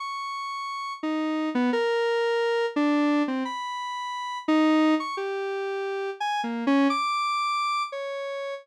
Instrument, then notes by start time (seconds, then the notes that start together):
lead 1 (square)
0.00 C#6
1.03 D#4
1.55 B3
1.73 A#4
2.76 D4
3.28 C4
3.45 B5
4.48 D#4
5.00 C#6
5.17 G4
6.20 G#5
6.44 A#3
6.67 C#4
6.90 D6
7.92 C#5